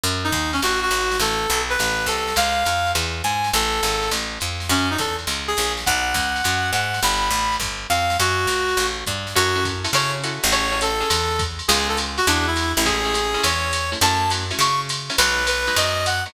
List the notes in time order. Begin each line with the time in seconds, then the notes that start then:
0.03 F#2, ride
0.24 D#4
0.32 D#2, kick, hi-hat pedal, ride
0.53 C#4, ride
0.62 A1 F#4, ride
0.82 F#4
0.91 G#1, hi-hat pedal, ride
1.11 snare, ride
1.20 A1 A4, ride
1.49 B1, hi-hat pedal, ride
1.69 B4, ride
1.79 A1, ride
2.06 C2 A4, hi-hat pedal, ride
2.28 snare, ride
2.36 C#2 F5, ride
2.65 F2, hi-hat pedal, ride
2.87 ride
2.95 E2, ride
3.24 G#2 G#5, hi-hat pedal, ride
3.44 snare, ride
3.53 A1 A4, ride
3.83 G#1, hi-hat pedal, ride
4.02 ride
4.11 A1, ride
4.40 F2, hi-hat pedal, ride
4.60 snare, ride
4.69 F#2 C#4, ride
4.90 D#4
4.98 E2 A4, kick, hi-hat pedal, ride
5.19 ride
5.27 C#2, ride
5.48 G#4
5.57 A#1, hi-hat pedal, ride
5.77 snare, ride
5.86 B1 F#5, kick, ride
6.14 C#2, kick, hi-hat pedal, ride
6.36 ride
6.44 F#2, ride
6.73 G#2 F#5, hi-hat pedal, ride
6.94 snare, ride
7.03 G1 B5, ride
7.30 A1, hi-hat pedal, ride
7.52 ride
7.60 G1, kick, ride
7.90 F2 F5, hi-hat pedal, ride
8.10 snare, ride
8.19 F#2 F#4, ride
8.47 C#2, hi-hat pedal, ride
8.69 ride
8.77 A1, ride
9.06 G2, kick, hi-hat pedal, ride
9.27 snare, ride
9.35 F#2 C#4 E4 F#4 A4, ride
9.56 C#4 E4 F#4 A4
9.65 kick, hi-hat pedal, ride
9.84 C#4 E4 F#4 A4, ride
9.93 C#3 C#4 E4 F#4 A4 C#5, ride
10.24 C#4 E4 F#4 A4, hi-hat pedal, ride
10.43 A1, ride
10.52 C#4 E4 G#4 A4 C#5, ride
10.72 C#4 E4 G#4 A4
10.81 A4, hi-hat pedal, ride
11.00 C#4 E4 G#4 A4, ride
11.10 E2, ride
11.39 kick, hi-hat pedal, ride
11.59 ride
11.68 C#2 B3 C#4 D#4 F4 G#4, ride
11.89 A4
11.97 hi-hat pedal, ride
12.18 F#4, ride
12.27 E2 G#3 D4 E4 F#4, ride
12.47 E4
12.56 hi-hat pedal, ride
12.77 A1 E4, ride
12.85 G#3 A3 C#4 E4 G#4, kick, ride
13.05 G#3 A3 C#4 E4
13.14 hi-hat pedal, ride
13.34 G#3 A3 C#4 E4, ride
13.43 E2 C#5, ride
13.73 hi-hat pedal, ride
13.92 G#3 A3 C#4 E4, ride
14.01 F#2 F#3 A3 C#4 E4 A5, ride
14.30 F#3 A3 C#4 E4, hi-hat pedal, ride
14.50 F#3 A3 C#4 E4, ride
14.59 C#3 C#6, ride
14.89 hi-hat pedal, ride
15.10 F#3 A3 C#4 E4, ride
15.18 B1 F#3 G#3 B3 D#4 B4, ride
15.47 B4, hi-hat pedal, ride
15.67 F#3 G#3 B3 D#4, ride
15.76 F#2 D#5, ride
16.06 F#5, hi-hat pedal, ride
16.26 F#3 G#3 B3 D#4, ride